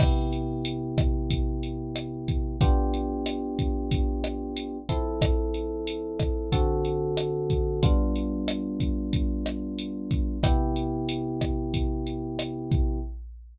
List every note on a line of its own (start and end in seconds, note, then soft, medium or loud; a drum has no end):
0.00 2.56 C3 medium
0.00 2.56 B3 medium
0.00 2.56 E4 medium
0.00 2.56 G4 medium
0.00 kick medium
0.00 cross-stick medium
0.00 crash medium
0.33 closed hi-hat medium
0.65 closed hi-hat medium
0.98 kick medium
0.98 cross-stick medium
0.98 closed hi-hat medium
1.30 kick medium
1.30 closed hi-hat medium
1.63 closed hi-hat medium
1.96 cross-stick medium
1.96 closed hi-hat medium
2.28 kick medium
2.28 closed hi-hat medium
2.61 4.78 B3 loud
2.61 4.78 D4 medium
2.61 4.78 F4 medium
2.61 4.78 G4 loud
2.61 kick medium
2.61 closed hi-hat medium
2.94 closed hi-hat medium
3.26 cross-stick medium
3.26 closed hi-hat medium
3.59 kick medium
3.59 closed hi-hat medium
3.91 kick medium
3.91 closed hi-hat medium
4.24 cross-stick medium
4.24 closed hi-hat medium
4.57 closed hi-hat medium
4.89 6.50 F3 medium
4.89 6.50 C4 medium
4.89 6.50 E4 medium
4.89 6.50 A4 medium
4.89 kick medium
4.89 closed hi-hat medium
5.21 kick medium
5.21 cross-stick medium
5.21 closed hi-hat medium
5.54 closed hi-hat medium
5.87 closed hi-hat medium
6.20 kick medium
6.20 cross-stick medium
6.20 closed hi-hat medium
6.52 7.80 D3 medium
6.52 7.80 C4 medium
6.52 7.80 F#4 medium
6.52 7.80 A4 medium
6.52 kick medium
6.52 closed hi-hat medium
6.85 closed hi-hat medium
7.17 cross-stick medium
7.17 closed hi-hat medium
7.50 kick medium
7.50 closed hi-hat medium
7.83 10.38 G3 medium
7.83 10.38 B3 loud
7.83 10.38 D4 medium
7.83 10.38 F4 medium
7.83 kick medium
7.83 closed hi-hat medium
8.16 closed hi-hat medium
8.48 cross-stick medium
8.48 closed hi-hat medium
8.80 kick medium
8.80 closed hi-hat medium
9.13 kick medium
9.13 closed hi-hat medium
9.46 cross-stick medium
9.46 closed hi-hat medium
9.79 closed hi-hat medium
10.11 kick medium
10.11 closed hi-hat medium
10.43 12.99 C3 medium
10.43 12.99 B3 medium
10.43 12.99 E4 loud
10.43 12.99 G4 loud
10.43 kick medium
10.43 cross-stick medium
10.43 closed hi-hat medium
10.76 closed hi-hat medium
11.09 closed hi-hat loud
11.41 kick medium
11.41 cross-stick medium
11.41 closed hi-hat medium
11.74 kick medium
11.74 closed hi-hat medium
12.07 closed hi-hat medium
12.39 cross-stick medium
12.39 closed hi-hat medium
12.71 kick medium
12.71 closed hi-hat soft